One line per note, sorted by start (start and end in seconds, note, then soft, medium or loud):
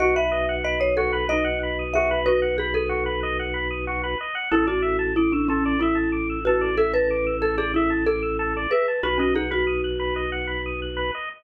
0.00 4.15 B1 loud
0.00 0.14 F#4 loud
0.00 0.26 F#4 loud
0.00 0.15 D#5 medium
0.16 0.31 B4 medium
0.16 0.55 E5 loud
0.31 0.46 D#5 medium
0.49 0.63 F#5 medium
0.64 0.80 D#5 loud
0.64 0.78 B5 medium
0.80 0.96 C#5 loud
0.80 0.94 D#6 medium
0.97 1.12 F#4 medium
0.97 1.25 A4 medium
1.13 1.27 B4 medium
1.29 1.84 D#4 medium
1.29 1.84 D#5 loud
1.29 1.44 D#5 medium
1.44 1.59 F#5 medium
1.63 1.78 B5 medium
1.79 1.93 D#6 medium
1.94 2.10 F#4 medium
1.94 2.25 G#4 loud
1.94 2.19 E5 loud
2.11 2.25 B4 medium
2.26 3.39 F#4 loud
2.26 2.56 B4 loud
2.26 2.40 D#5 medium
2.42 2.56 F#5 medium
2.58 2.73 G#4 loud
2.58 2.74 B5 medium
2.74 3.48 A4 medium
2.74 2.89 D#6 medium
2.89 3.04 F#4 medium
3.06 3.20 B4 medium
3.23 3.37 D#5 medium
3.39 3.54 F#5 medium
3.54 3.68 B5 medium
3.70 3.85 D#6 medium
3.87 4.02 F#4 medium
4.03 4.18 B4 medium
4.20 4.35 D#5 medium
4.35 4.49 F#5 medium
4.51 8.67 A1 loud
4.51 4.67 E4 loud
4.51 4.66 A4 loud
4.51 4.83 A4 loud
4.67 5.11 F#4 medium
4.67 4.81 D5 medium
4.82 4.97 E5 medium
4.99 5.13 A5 medium
5.16 5.31 E4 loud
5.16 5.31 D6 medium
5.32 5.48 D4 medium
5.32 5.47 E6 medium
5.48 5.77 C#4 loud
5.48 5.64 A4 medium
5.65 5.80 D5 medium
5.79 6.34 E4 loud
5.79 6.39 E4 loud
5.79 5.96 E5 medium
5.95 6.10 A5 medium
6.12 6.27 D6 medium
6.30 6.44 E6 medium
6.45 6.72 F#4 medium
6.45 6.61 A4 medium
6.45 6.76 B4 loud
6.61 6.76 D5 medium
6.77 6.93 A4 loud
6.77 7.06 A4 loud
6.77 6.92 E5 medium
6.94 7.36 B4 loud
6.94 7.08 A5 medium
7.10 7.25 D6 medium
7.26 7.41 E6 medium
7.41 7.56 A4 medium
7.41 7.57 A4 loud
7.57 7.73 G#4 loud
7.57 7.72 D5 medium
7.74 8.04 E4 medium
7.74 7.90 E5 medium
7.90 8.05 A5 medium
8.06 8.58 A4 loud
8.06 8.64 A4 loud
8.06 8.21 D6 medium
8.22 8.37 E6 medium
8.39 8.53 A4 medium
8.56 8.71 D5 medium
8.71 8.97 G#4 medium
8.71 9.00 B4 loud
8.71 8.86 E5 medium
8.88 9.02 A5 medium
9.03 11.11 B1 loud
9.03 9.33 F#4 loud
9.03 9.19 F#4 loud
9.03 9.18 B4 loud
9.18 9.33 C#4 loud
9.18 9.34 D#5 medium
9.34 10.39 D#4 loud
9.34 9.51 G#4 medium
9.34 9.50 F#5 medium
9.51 10.26 F#4 loud
9.51 9.65 B5 medium
9.67 9.81 D#6 medium
9.84 9.98 F#6 medium
9.99 10.14 B4 medium
10.16 10.30 D#5 medium
10.32 10.47 F#5 medium
10.47 10.62 B5 medium
10.66 10.80 D#6 medium
10.82 10.96 F#6 medium
10.97 11.11 B4 medium
11.15 11.29 D#5 medium